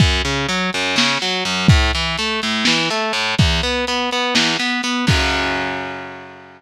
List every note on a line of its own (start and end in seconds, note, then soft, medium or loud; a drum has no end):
0.00 0.22 F#2 loud
0.00 kick loud
0.00 closed hi-hat loud
0.25 0.47 C#3 medium
0.25 closed hi-hat medium
0.49 0.70 F#3 medium
0.49 closed hi-hat loud
0.73 0.96 F#2 medium
0.73 closed hi-hat medium
0.96 1.18 C#3 loud
0.96 snare loud
1.21 1.44 F#3 medium
1.21 closed hi-hat medium
1.45 1.67 F#2 medium
1.45 closed hi-hat medium
1.68 1.91 A2 loud
1.68 kick loud
1.68 closed hi-hat loud
1.93 2.16 E3 medium
1.93 closed hi-hat medium
2.18 2.40 A3 medium
2.18 closed hi-hat loud
2.42 2.65 A2 medium
2.42 closed hi-hat medium
2.65 2.89 E3 medium
2.65 snare loud
2.90 3.12 A3 medium
2.90 closed hi-hat medium
3.13 3.35 A2 medium
3.13 closed hi-hat medium
3.38 3.61 E2 loud
3.38 kick loud
3.38 closed hi-hat loud
3.62 3.85 B3 medium
3.62 closed hi-hat medium
3.87 4.10 B3 medium
3.87 closed hi-hat loud
4.11 4.34 B3 medium
4.11 closed hi-hat medium
4.35 4.57 E2 medium
4.35 snare loud
4.59 4.81 B3 medium
4.59 closed hi-hat medium
4.83 5.05 B3 medium
4.83 closed hi-hat medium
5.07 6.61 F#2 loud
5.07 6.61 C#3 medium
5.07 6.61 F#3 loud
5.07 kick loud
5.07 crash loud